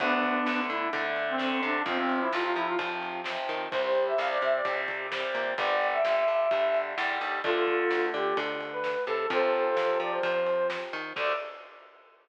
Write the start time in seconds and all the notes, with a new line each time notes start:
0.00 D2 D3 A3 B3 D4, kick, ride
0.23 kick, ride
0.46 D2 D3 A3, snare
0.70 D3 E4, ride
0.93 D3 A3, kick, ride
1.16 ride
1.29 C4
1.38 D3 A3, snare
1.63 C3 D4, ride
1.86 F2 C3 F3 C4, kick, ride
1.99 C4
2.09 ride
2.21 E4
2.32 F2 C3 F3 F4, snare
2.44 F4
2.56 F3 E4, ride
2.67 F4
2.79 C3 F3, kick, ride
3.02 ride
3.24 C3 F3, snare
3.49 D#3, ride
3.71 C2 C3 G3 C5, kick, ride
3.84 C5
3.95 ride
4.07 E5
4.18 C2 C3 G3 F5, snare
4.31 D5
4.42 C3 E5, ride
4.55 D5
4.65 C3 G3, kick, ride
4.88 kick, ride
5.12 C3 G3, snare
5.35 A#2, ride
5.57 G1 D3 G3 D5, kick, ride
5.81 ride
5.92 E5
6.04 G1 D3 G3, snare
6.28 G2, ride
6.51 G2 D3 G3, kick, ride
6.74 ride
6.98 E2 D3 G3, snare
7.21 D#2, ride
7.44 D2 D3 A3 F4 A4, kick, ride
7.67 kick, ride
7.90 D2, snare
8.14 D3 G4, ride
8.37 D3, kick, ride
8.61 ride
8.72 B4
8.84 snare
9.06 C3 A4, ride
9.30 F2 C3 F3 A4 C5, kick, ride
9.53 ride
9.77 F2, snare
10.00 F3 D5, ride
10.11 C5
10.23 F3 C5, kick, ride
10.47 ride
10.70 snare
10.93 D#3, ride
11.16 D2 D3 A3 D5, kick, crash